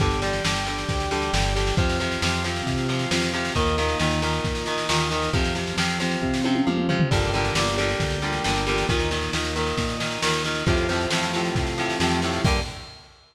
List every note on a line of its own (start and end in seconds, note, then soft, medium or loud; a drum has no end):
0.00 0.41 G1 loud
0.00 0.20 D3 loud
0.00 0.20 G3 loud
0.00 1.74 D4 medium
0.00 1.74 G4 medium
0.00 kick medium
0.00 snare medium
0.11 snare medium
0.22 0.43 D3 medium
0.22 0.43 G3 medium
0.22 snare medium
0.33 snare medium
0.44 0.85 G1 medium
0.44 0.65 D3 medium
0.44 0.65 G3 loud
0.44 snare loud
0.56 snare medium
0.66 1.08 D3 medium
0.66 1.08 G3 medium
0.66 snare medium
0.78 snare medium
0.89 1.30 D2 medium
0.89 kick medium
0.89 snare medium
1.00 snare medium
1.11 1.32 D3 medium
1.11 1.32 G3 loud
1.11 snare medium
1.22 snare medium
1.33 1.73 G1 medium
1.33 1.54 D3 medium
1.33 1.54 G3 medium
1.33 snare loud
1.45 snare medium
1.56 1.76 D3 medium
1.56 1.76 G3 medium
1.56 snare medium
1.67 snare medium
1.77 2.18 F2 medium
1.77 1.98 C3 loud
1.77 1.98 F3 loud
1.77 3.52 C4 medium
1.77 3.52 F4 medium
1.77 kick loud
1.77 snare medium
1.89 snare medium
2.00 2.20 C3 loud
2.00 2.20 F3 medium
2.00 snare medium
2.11 snare medium
2.22 2.62 F2 medium
2.22 2.43 C3 loud
2.22 2.43 F3 medium
2.22 snare loud
2.33 snare medium
2.44 2.85 C3 medium
2.44 2.85 F3 medium
2.44 snare medium
2.56 snare medium
2.66 3.06 C3 medium
2.66 kick medium
2.66 snare medium
2.78 snare medium
2.89 3.09 C3 medium
2.89 3.09 F3 medium
2.89 snare medium
2.99 snare medium
3.11 3.51 F2 medium
3.11 3.32 C3 medium
3.11 3.32 F3 medium
3.11 snare loud
3.22 snare medium
3.33 3.54 C3 medium
3.33 3.54 F3 medium
3.33 snare medium
3.45 snare medium
3.55 3.95 D#2 medium
3.55 3.76 A#2 medium
3.55 3.76 D#3 loud
3.55 5.30 A#3 medium
3.55 5.30 D#4 medium
3.55 kick medium
3.55 snare medium
3.67 snare medium
3.78 3.98 A#2 loud
3.78 3.98 D#3 loud
3.78 snare medium
3.89 snare medium
3.99 4.40 D#2 medium
3.99 4.20 A#2 medium
3.99 4.20 D#3 loud
3.99 snare medium
4.11 snare medium
4.22 4.63 A#2 medium
4.22 4.63 D#3 medium
4.22 snare medium
4.33 snare medium
4.44 4.85 A#2 medium
4.44 kick medium
4.44 snare medium
4.55 snare medium
4.66 4.87 A#2 medium
4.66 4.87 D#3 medium
4.66 snare medium
4.78 snare medium
4.89 5.29 D#2 medium
4.89 5.09 A#2 loud
4.89 5.09 D#3 loud
4.89 snare loud
5.00 snare medium
5.11 5.32 A#2 medium
5.11 5.32 D#3 medium
5.11 snare medium
5.22 snare medium
5.33 5.73 F2 medium
5.33 5.54 C3 loud
5.33 5.54 F3 loud
5.33 7.08 C4 medium
5.33 7.08 F4 medium
5.33 kick medium
5.33 snare medium
5.45 snare medium
5.55 5.76 C3 medium
5.55 5.76 F3 medium
5.55 snare medium
5.67 snare medium
5.77 6.17 F2 medium
5.77 5.98 C3 loud
5.77 5.98 F3 medium
5.77 snare loud
5.89 snare medium
6.00 6.41 C3 medium
6.00 6.41 F3 medium
6.00 snare medium
6.11 snare medium
6.22 6.62 C3 medium
6.22 kick medium
6.34 snare medium
6.44 6.65 C3 medium
6.44 6.65 F3 medium
6.44 high tom medium
6.55 high tom medium
6.67 7.07 F2 medium
6.67 6.87 C3 medium
6.67 6.87 F3 medium
6.67 mid tom medium
6.78 mid tom medium
6.89 7.09 C3 medium
6.89 7.09 F3 loud
6.89 floor tom medium
7.00 floor tom loud
7.11 7.51 G1 loud
7.11 7.31 A#2 loud
7.11 7.31 D3 loud
7.11 7.31 G3 loud
7.11 8.85 A#3 medium
7.11 8.85 D4 medium
7.11 8.85 G4 medium
7.11 kick medium
7.11 snare medium
7.11 crash medium
7.22 snare medium
7.33 7.54 A#2 loud
7.33 7.54 D3 medium
7.33 7.54 G3 medium
7.33 snare medium
7.45 snare medium
7.55 7.95 G1 medium
7.55 7.76 A#2 medium
7.55 7.76 D3 medium
7.55 7.76 G3 loud
7.55 snare loud
7.67 snare medium
7.78 8.19 A#2 medium
7.78 8.19 D3 medium
7.78 8.19 G3 medium
7.78 snare medium
7.89 snare medium
8.00 8.40 D2 medium
8.00 kick medium
8.00 snare medium
8.10 snare medium
8.22 8.43 A#2 medium
8.22 8.43 D3 medium
8.22 8.43 G3 medium
8.22 snare medium
8.33 snare medium
8.44 8.85 G1 medium
8.44 8.65 A#2 medium
8.44 8.65 D3 medium
8.44 8.65 G3 medium
8.44 snare medium
8.56 snare medium
8.67 8.87 A#2 medium
8.67 8.87 D3 medium
8.67 8.87 G3 medium
8.67 snare medium
8.78 snare medium
8.89 9.29 D#2 medium
8.89 9.09 A#2 loud
8.89 9.09 D#3 loud
8.89 10.63 A#3 medium
8.89 10.63 D#4 medium
8.89 kick medium
8.89 snare medium
8.99 snare medium
9.11 9.32 A#2 medium
9.11 9.32 D#3 medium
9.11 snare medium
9.23 snare medium
9.33 9.74 D#2 medium
9.33 9.54 A#2 medium
9.33 9.54 D#3 medium
9.33 snare medium
9.45 snare medium
9.56 9.96 A#2 medium
9.56 9.96 D#3 medium
9.56 snare medium
9.67 snare medium
9.77 10.18 A#2 medium
9.77 kick medium
9.77 snare medium
9.89 snare medium
10.00 10.20 A#2 medium
10.00 10.20 D#3 medium
10.00 snare medium
10.11 snare medium
10.22 10.63 D#2 medium
10.22 10.43 A#2 medium
10.22 10.43 D#3 medium
10.22 snare loud
10.33 snare medium
10.44 10.65 A#2 loud
10.44 10.65 D#3 medium
10.44 snare medium
10.55 snare medium
10.66 11.07 F2 loud
10.66 10.87 A2 loud
10.66 10.87 C3 loud
10.66 10.87 F3 medium
10.66 12.41 A3 medium
10.66 12.41 C4 medium
10.66 12.41 F4 medium
10.66 kick medium
10.66 snare medium
10.77 snare medium
10.89 11.09 A2 medium
10.89 11.09 C3 medium
10.89 11.09 F3 loud
10.89 snare medium
11.01 snare medium
11.10 11.50 F2 medium
11.10 11.32 A2 medium
11.10 11.32 C3 medium
11.10 11.32 F3 medium
11.10 snare loud
11.23 snare medium
11.33 11.74 A2 medium
11.33 11.74 C3 medium
11.33 11.74 F3 medium
11.33 snare medium
11.45 snare medium
11.55 11.95 C3 medium
11.55 kick medium
11.55 snare medium
11.67 snare medium
11.78 11.98 A2 medium
11.78 11.98 C3 medium
11.78 11.98 F3 medium
11.78 snare medium
11.90 snare medium
12.00 12.40 F2 medium
12.00 12.21 A2 medium
12.00 12.21 C3 loud
12.00 12.21 F3 medium
12.00 snare medium
12.11 snare medium
12.22 12.43 A2 loud
12.22 12.43 C3 medium
12.22 12.43 F3 medium
12.22 snare medium
12.33 snare medium
12.44 12.59 G2 loud
12.44 12.60 D3 loud
12.44 12.60 G3 loud
12.44 12.60 A#3 loud
12.44 12.60 A#3 medium
12.44 12.60 D4 loud
12.44 12.60 G4 medium
12.44 kick loud
12.44 crash loud